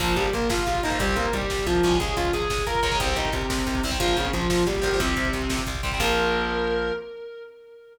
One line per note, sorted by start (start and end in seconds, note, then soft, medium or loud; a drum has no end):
0.00 0.14 A#1 loud
0.00 0.14 F3 loud
0.00 0.26 F3 medium
0.00 0.26 A#3 medium
0.00 0.14 F4 loud
0.00 kick loud
0.00 crash loud
0.08 kick loud
0.16 0.30 A#1 medium
0.16 0.33 G3 medium
0.16 0.33 G4 medium
0.16 kick loud
0.16 closed hi-hat medium
0.25 kick loud
0.33 0.48 A#1 medium
0.33 0.48 A#3 medium
0.33 0.48 A#4 loud
0.33 kick medium
0.33 closed hi-hat medium
0.42 kick loud
0.49 0.64 A#1 medium
0.49 0.66 F4 medium
0.49 0.66 F5 loud
0.49 kick loud
0.49 snare loud
0.58 kick loud
0.67 0.81 A#1 medium
0.67 0.81 F4 medium
0.67 0.81 F5 loud
0.67 kick medium
0.67 closed hi-hat medium
0.75 kick loud
0.83 0.99 A#1 medium
0.83 0.89 F3 medium
0.83 0.89 A#3 medium
0.83 0.97 D#4 medium
0.83 0.97 D#5 loud
0.83 kick medium
0.83 closed hi-hat medium
0.90 0.97 F3 medium
0.90 0.97 A#3 medium
0.90 kick loud
0.99 1.15 C2 loud
0.99 1.26 G3 medium
0.99 1.14 G3 loud
0.99 1.26 C4 loud
0.99 1.14 G4 loud
0.99 kick loud
0.99 closed hi-hat loud
1.08 kick medium
1.16 1.30 C2 medium
1.16 1.33 A#3 medium
1.16 1.33 A#4 loud
1.16 kick medium
1.16 closed hi-hat medium
1.25 kick medium
1.33 1.47 C2 medium
1.33 1.65 G3 loud
1.33 1.65 G4 loud
1.33 kick medium
1.33 closed hi-hat loud
1.42 kick loud
1.50 1.65 C2 medium
1.50 kick loud
1.50 snare loud
1.58 kick medium
1.66 1.81 C2 medium
1.66 1.94 F3 loud
1.66 1.94 F4 loud
1.66 kick loud
1.66 closed hi-hat medium
1.75 kick medium
1.83 1.98 C2 medium
1.83 2.28 G#3 medium
1.83 2.28 C#4 medium
1.83 kick loud
1.83 closed hi-hat medium
1.92 kick loud
2.00 2.15 C#2 medium
2.00 2.16 G#4 loud
2.00 2.16 G#5 loud
2.00 kick loud
2.00 closed hi-hat loud
2.08 kick loud
2.17 2.31 C#2 medium
2.17 2.31 F4 loud
2.17 2.31 F5 loud
2.17 kick loud
2.17 closed hi-hat loud
2.25 kick loud
2.33 2.48 C#2 medium
2.33 2.62 G#4 medium
2.33 2.62 G#5 loud
2.33 kick medium
2.33 closed hi-hat loud
2.42 kick medium
2.50 2.65 C#2 medium
2.50 kick loud
2.50 snare loud
2.58 kick loud
2.67 2.81 C#2 medium
2.67 2.94 A#4 medium
2.67 2.94 A#5 loud
2.67 kick medium
2.67 closed hi-hat medium
2.75 kick loud
2.83 2.97 C#2 medium
2.83 2.89 G#3 medium
2.83 2.89 C#4 medium
2.83 kick loud
2.83 closed hi-hat loud
2.91 2.98 G#3 medium
2.91 2.98 C#4 medium
2.91 kick loud
3.00 3.14 C2 loud
3.00 3.28 G3 medium
3.00 3.15 C4 loud
3.00 3.28 C4 loud
3.00 3.15 C5 loud
3.00 kick loud
3.00 closed hi-hat loud
3.08 kick medium
3.16 3.30 C2 medium
3.16 3.32 D#4 loud
3.16 3.32 D#5 loud
3.16 kick loud
3.16 closed hi-hat medium
3.25 kick loud
3.32 3.47 C2 medium
3.32 3.82 C3 medium
3.32 3.82 C4 medium
3.32 kick loud
3.32 closed hi-hat medium
3.42 kick medium
3.50 3.64 C2 medium
3.50 kick loud
3.50 snare loud
3.58 kick loud
3.67 3.81 C2 medium
3.67 kick loud
3.67 closed hi-hat medium
3.75 kick loud
3.83 3.98 C2 medium
3.83 3.90 G3 medium
3.83 3.90 C4 medium
3.83 kick medium
3.83 open hi-hat loud
3.91 3.98 G3 medium
3.91 3.98 C4 medium
3.91 kick loud
4.00 4.14 A#1 loud
4.00 4.27 F3 medium
4.00 4.15 F3 loud
4.00 4.27 A#3 medium
4.00 4.15 F4 loud
4.00 kick loud
4.00 closed hi-hat loud
4.08 kick loud
4.17 4.31 A#1 medium
4.17 4.31 C#3 medium
4.17 4.31 C#4 loud
4.17 kick medium
4.17 closed hi-hat medium
4.25 kick loud
4.33 4.48 A#1 medium
4.33 4.63 F3 medium
4.33 4.63 F4 loud
4.33 kick loud
4.33 closed hi-hat loud
4.42 kick loud
4.50 4.64 A#1 medium
4.50 kick loud
4.50 snare loud
4.58 kick medium
4.67 4.81 A#1 medium
4.67 4.97 G3 medium
4.67 4.97 G4 medium
4.67 kick medium
4.67 closed hi-hat medium
4.75 kick loud
4.82 4.97 A#1 medium
4.82 4.88 F3 medium
4.82 4.88 A#3 medium
4.82 kick loud
4.82 closed hi-hat medium
4.92 5.00 F3 medium
4.92 5.00 A#3 medium
4.92 kick medium
5.00 5.14 C2 loud
5.00 5.61 C3 loud
5.00 5.27 G3 medium
5.00 5.61 C4 loud
5.00 5.27 C4 loud
5.00 kick loud
5.00 closed hi-hat loud
5.08 kick medium
5.17 5.31 C2 medium
5.17 kick loud
5.17 closed hi-hat medium
5.25 kick loud
5.33 5.48 C2 medium
5.33 kick medium
5.33 closed hi-hat medium
5.42 kick medium
5.49 5.64 C2 medium
5.49 kick loud
5.49 snare loud
5.58 kick loud
5.67 5.81 C2 medium
5.67 kick loud
5.67 closed hi-hat loud
5.75 kick loud
5.83 5.99 C2 medium
5.83 5.90 G3 medium
5.83 5.90 C4 medium
5.83 kick loud
5.83 closed hi-hat medium
5.92 6.00 G3 medium
5.92 6.00 C4 medium
5.92 kick loud
6.00 6.91 A#1 loud
6.00 6.92 F3 loud
6.00 6.92 A#3 loud
6.00 6.92 A#4 loud
6.00 kick loud
6.00 crash loud